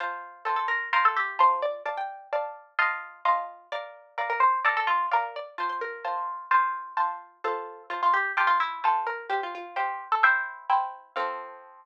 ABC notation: X:1
M:4/4
L:1/16
Q:1/4=129
K:F
V:1 name="Harpsichord"
c4 A A B2 B A G2 c2 d2 | a g9 z6 | d4 B B c2 A A F2 B2 d2 | c c B12 z2 |
A4 F F G2 G F E2 A2 B2 | G F F2 G3 A e4 z4 | f16 |]
V:2 name="Harpsichord"
[Fa]4 [Fca]4 [Fca]4 [Fa]4 | [df]4 [dfa]4 [F_eac']4 [Feac']4 | [Bf]4 [df]4 [Bdf]4 [df]4 | [Fa]4 [Fca]4 [Fca]4 [Fca]4 |
[Fca]4 [ca]4 [Fca]4 [Fca]4 | [cfg]4 [cfg]4 [Ecg]4 [Ecg]4 | [F,CA]16 |]